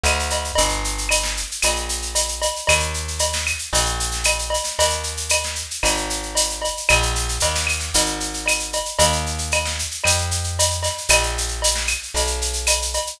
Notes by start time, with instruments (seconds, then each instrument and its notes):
0.04 electric bass (finger) D2, cowbell, claves, shaker
0.19 shaker
0.30 cowbell, shaker
0.44 shaker
0.55 electric bass (finger) G1, cowbell, shaker
0.69 shaker
0.84 shaker
0.98 shaker
1.09 cowbell, claves, shaker
1.23 snare, shaker
1.37 shaker
1.51 shaker
1.62 electric bass (finger) A#1, cowbell, claves, shaker
1.76 shaker
1.89 shaker
2.02 shaker
2.15 cowbell, shaker
2.28 shaker
2.42 cowbell, shaker
2.56 shaker
2.67 electric bass (finger) D#2, cowbell, claves, shaker
2.80 shaker
2.94 shaker
3.08 shaker
3.19 cowbell, shaker
3.33 snare, shaker
3.47 claves, shaker
3.59 shaker
3.73 electric bass (finger) A#1, cowbell, shaker
3.86 shaker
4.00 shaker
4.11 snare, shaker
4.24 cowbell, claves, shaker
4.39 shaker
4.50 cowbell, shaker
4.64 snare, shaker
4.79 electric bass (finger) D#2, cowbell, shaker
4.90 shaker
5.03 shaker
5.17 shaker
5.29 cowbell, claves, shaker
5.43 snare, shaker
5.55 shaker
5.71 shaker
5.83 electric bass (finger) G#1, cowbell, claves, shaker
5.97 shaker
6.10 shaker
6.23 shaker
6.35 cowbell, shaker
6.49 shaker
6.62 cowbell, shaker
6.77 shaker
6.89 electric bass (finger) A#1, cowbell, claves, shaker
7.02 shaker
7.15 snare, shaker
7.29 shaker
7.40 electric bass (finger) D#2, cowbell, shaker
7.55 snare, shaker
7.67 claves, shaker
7.80 snare, shaker
7.94 electric bass (finger) G#1, cowbell, shaker
8.06 shaker
8.20 shaker
8.34 shaker
8.46 cowbell, claves, shaker
8.60 shaker
8.73 cowbell, shaker
8.85 shaker
8.99 electric bass (finger) D#2, cowbell, shaker
9.13 shaker
9.26 shaker
9.38 shaker
9.52 cowbell, claves, shaker
9.65 snare, shaker
9.79 shaker
9.91 shaker
10.04 electric bass (finger) F2, cowbell, claves, shaker
10.18 shaker
10.31 shaker
10.44 shaker
10.59 cowbell, shaker
10.70 shaker
10.83 snare, cowbell, shaker
10.98 shaker
11.09 electric bass (finger) A#1, cowbell, claves, shaker
11.23 shaker
11.38 shaker
11.48 shaker
11.62 cowbell, shaker
11.75 snare, shaker
11.87 claves, shaker
12.03 shaker
12.14 electric bass (finger) B1, cowbell, shaker
12.27 shaker
12.42 shaker
12.53 shaker
12.67 cowbell, claves, shaker
12.82 shaker
12.94 cowbell, shaker
13.07 shaker